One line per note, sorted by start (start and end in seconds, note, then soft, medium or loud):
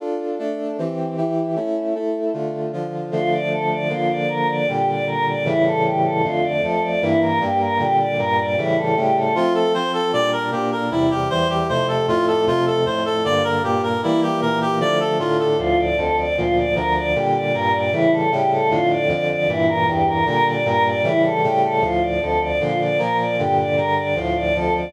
0.00 0.38 D4 medium
0.00 0.39 F4 medium
0.00 0.38 A4 medium
0.39 0.77 A3 medium
0.39 0.77 D4 medium
0.39 0.77 A4 medium
0.78 1.17 E3 medium
0.78 1.17 C4 medium
0.78 1.17 G4 medium
1.17 1.56 E3 medium
1.17 1.55 E4 medium
1.17 1.56 G4 medium
1.56 1.94 A3 medium
1.56 1.94 C#4 medium
1.56 1.94 E4 medium
1.95 2.33 A3 medium
1.95 2.33 E4 medium
1.95 2.33 A4 medium
2.33 2.72 D3 medium
2.33 2.72 A3 medium
2.33 2.72 F4 medium
2.73 3.11 D3 medium
2.73 3.11 F3 medium
2.73 3.11 F4 medium
3.11 3.89 D3 medium
3.11 3.89 F3 medium
3.11 3.89 A3 medium
3.11 3.30 F4 medium
3.31 3.49 D5 medium
3.51 3.69 A4 medium
3.70 3.88 D5 medium
3.89 4.66 D3 medium
3.89 4.66 F3 medium
3.89 4.66 A#3 medium
3.89 4.08 F4 medium
4.09 4.27 D5 medium
4.29 4.47 A#4 medium
4.48 4.66 D5 medium
4.68 5.45 A#2 medium
4.68 5.45 D3 medium
4.68 5.44 G3 medium
4.68 4.86 G4 medium
4.87 5.05 D5 medium
5.07 5.25 A#4 medium
5.26 5.44 D5 medium
5.45 6.22 A2 medium
5.45 6.22 C#3 medium
5.45 6.22 E3 medium
5.45 6.22 G3 medium
5.45 5.63 E4 medium
5.65 5.83 A4 medium
5.84 6.02 G4 medium
6.04 6.22 A4 medium
6.23 6.62 F2 medium
6.23 6.62 D3 medium
6.23 6.62 A3 medium
6.23 6.41 F4 medium
6.43 6.61 D5 medium
6.62 7.02 F2 medium
6.62 7.02 F3 medium
6.62 7.02 A3 medium
6.62 6.80 A4 medium
6.82 7.00 D5 medium
7.01 7.40 G2 loud
7.01 7.40 E3 medium
7.01 7.40 A#3 medium
7.01 7.19 E4 medium
7.21 7.39 A#4 medium
7.40 7.79 G2 medium
7.40 7.78 G3 medium
7.40 7.79 A#3 medium
7.40 7.58 G4 medium
7.60 7.78 A#4 medium
7.79 8.17 A#2 medium
7.79 8.17 D3 medium
7.79 8.17 G3 medium
7.79 7.97 G4 medium
7.99 8.17 D5 medium
8.18 8.56 G2 medium
8.18 8.56 A#2 medium
8.18 8.56 G3 medium
8.18 8.36 A#4 medium
8.38 8.56 D5 medium
8.57 8.96 A2 medium
8.57 8.96 C#3 medium
8.57 8.96 E3 medium
8.57 8.96 G3 medium
8.57 8.75 E4 medium
8.77 8.95 A4 medium
8.96 9.35 A2 medium
8.96 9.35 C#3 medium
8.96 9.35 G3 medium
8.96 9.35 A3 medium
8.96 9.14 G4 medium
9.16 9.33 A4 medium
9.35 9.73 F3 medium
9.35 9.74 A3 medium
9.35 9.73 C4 medium
9.35 9.53 F4 medium
9.54 9.72 A4 medium
9.74 10.12 F3 medium
9.74 10.12 C4 medium
9.74 10.12 F4 medium
9.74 9.92 C5 medium
9.93 10.11 A4 medium
10.13 10.51 A#2 medium
10.13 10.51 G3 medium
10.13 10.51 D4 medium
10.13 10.31 D5 medium
10.32 10.50 A#4 medium
10.51 10.90 A#2 medium
10.51 10.90 A#3 medium
10.51 10.90 D4 medium
10.51 10.70 G4 medium
10.72 10.90 A#4 medium
10.91 11.29 E2 medium
10.91 11.30 C3 medium
10.91 11.29 G3 medium
10.91 11.09 E4 medium
11.10 11.28 G4 medium
11.30 11.68 E2 medium
11.30 11.68 E3 medium
11.30 11.68 G3 medium
11.30 11.48 C5 medium
11.49 11.67 G4 medium
11.69 12.07 F2 medium
11.69 12.07 C3 medium
11.69 12.07 A3 medium
11.69 11.87 C5 medium
11.88 12.06 A4 medium
12.08 12.46 F2 medium
12.08 12.46 A2 medium
12.08 12.46 A3 medium
12.08 12.26 F4 medium
12.27 12.45 A4 medium
12.46 12.85 F2 medium
12.46 12.85 C3 medium
12.46 12.85 A3 medium
12.46 12.65 F4 medium
12.66 12.84 A4 medium
12.86 13.25 F2 medium
12.86 13.25 A2 medium
12.86 13.25 A3 medium
12.86 13.04 C5 medium
13.05 13.23 A4 medium
13.24 13.63 G2 medium
13.24 13.63 D3 medium
13.24 13.63 A#3 medium
13.24 13.43 D5 medium
13.44 13.62 A#4 medium
13.63 14.02 G2 medium
13.63 14.02 A#2 medium
13.63 14.02 A#3 medium
13.63 13.81 G4 medium
13.83 14.01 A#4 medium
14.03 14.41 E3 medium
14.03 14.42 G3 medium
14.03 14.41 A#3 medium
14.03 14.21 E4 medium
14.22 14.40 G4 medium
14.41 14.80 A#2 medium
14.41 14.80 E3 medium
14.41 14.80 A#3 medium
14.41 14.59 A#4 medium
14.61 14.79 G4 medium
14.80 15.19 D3 medium
14.80 15.19 F3 medium
14.80 15.19 A3 medium
14.80 14.98 D5 medium
15.00 15.18 A4 medium
15.19 15.58 A2 medium
15.19 15.58 D3 medium
15.19 15.58 A3 medium
15.19 15.37 F4 medium
15.39 15.57 A4 medium
15.58 15.97 D2 medium
15.58 15.97 A2 medium
15.58 15.97 F3 medium
15.58 15.76 F4 loud
15.78 15.96 D5 medium
15.97 16.36 D2 medium
15.97 16.36 F2 loud
15.97 16.36 F3 medium
15.97 16.15 A4 medium
16.17 16.35 D5 medium
16.36 16.74 D2 medium
16.36 16.76 A#2 medium
16.36 16.74 F3 medium
16.36 16.54 F4 medium
16.56 16.74 D5 medium
16.75 17.13 D2 medium
16.75 17.13 D3 medium
16.75 17.13 F3 medium
16.75 16.93 A#4 medium
16.95 17.13 D5 medium
17.14 17.53 A#2 medium
17.14 17.54 D3 medium
17.14 17.53 G3 medium
17.14 17.32 G4 medium
17.34 17.52 D5 medium
17.53 17.92 G2 medium
17.53 17.92 A#2 medium
17.53 17.91 G3 medium
17.53 17.71 A#4 medium
17.73 17.91 D5 medium
17.92 18.30 A2 medium
17.92 18.30 C#3 medium
17.92 18.30 E3 medium
17.92 18.30 G3 medium
17.92 18.10 E4 medium
18.12 18.30 A4 medium
18.31 18.70 A2 medium
18.31 18.70 C#3 medium
18.31 18.70 G3 medium
18.31 18.70 A3 medium
18.31 18.49 G4 medium
18.51 18.69 A4 medium
18.70 19.08 F2 medium
18.70 19.09 A2 loud
18.70 19.08 D3 medium
18.70 18.88 F4 medium
18.90 19.08 D5 medium
19.08 19.47 F2 medium
19.08 19.47 D3 medium
19.08 19.47 F3 medium
19.08 19.27 D5 medium
19.29 19.47 D5 medium
19.48 19.87 G2 medium
19.48 19.87 A#2 medium
19.48 19.87 E3 medium
19.48 19.66 E4 medium
19.68 19.85 A#4 medium
19.87 20.26 E2 medium
19.87 20.26 G2 medium
19.87 20.26 E3 medium
19.87 20.05 G4 medium
20.06 20.24 A#4 medium
20.26 20.64 A#2 loud
20.26 20.64 D3 medium
20.26 20.64 G3 medium
20.26 20.44 A#4 medium
20.46 20.64 D5 medium
20.65 21.03 G2 medium
20.65 21.03 A#2 loud
20.65 21.03 G3 medium
20.65 20.83 A#4 medium
20.84 21.02 D5 medium
21.04 21.42 A2 medium
21.04 21.42 C#3 medium
21.04 21.42 E3 medium
21.04 21.42 G3 loud
21.04 21.22 E4 medium
21.23 21.41 A4 medium
21.43 21.81 A2 medium
21.43 21.82 C#3 medium
21.43 21.82 G3 medium
21.43 21.82 A3 medium
21.43 21.61 G4 medium
21.62 21.80 A4 medium
21.81 22.20 D2 medium
21.81 22.20 A2 medium
21.81 22.20 F3 medium
21.81 22.00 F4 medium
22.01 22.19 D5 medium
22.21 22.60 D2 medium
22.21 22.60 F2 medium
22.21 22.59 F3 medium
22.21 22.39 A4 medium
22.40 22.58 D5 medium
22.60 22.98 A#2 medium
22.60 22.99 D3 medium
22.60 22.98 F3 medium
22.60 22.78 F4 medium
22.79 22.97 D5 medium
22.98 23.37 A#2 medium
22.98 23.37 F3 medium
22.98 23.37 A#3 medium
22.98 23.17 A#4 medium
23.18 23.36 D5 medium
23.38 23.76 G2 medium
23.38 23.77 A#2 medium
23.38 23.76 D3 loud
23.38 23.56 G4 medium
23.57 23.75 D5 medium
23.76 24.15 G2 medium
23.76 24.15 D3 medium
23.76 24.15 G3 medium
23.76 23.94 A#4 medium
23.96 24.14 D5 medium
24.16 24.54 D2 medium
24.16 24.54 A2 medium
24.16 24.54 F3 medium
24.16 24.34 F4 medium
24.35 24.53 D5 medium
24.55 24.93 D2 medium
24.55 24.93 F2 medium
24.55 24.93 F3 loud
24.55 24.73 A4 medium
24.74 24.92 D5 medium